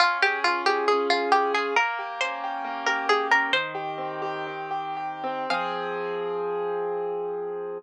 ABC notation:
X:1
M:2/2
L:1/8
Q:1/2=68
K:Fm
V:1 name="Harpsichord"
F G F G A F G A | B2 c3 B A B | "^rit." c3 z5 | f8 |]
V:2 name="Acoustic Grand Piano"
D A F A D A A F | B, G D G B, G G D | "^rit." E, G C G E, G G C | [F,CA]8 |]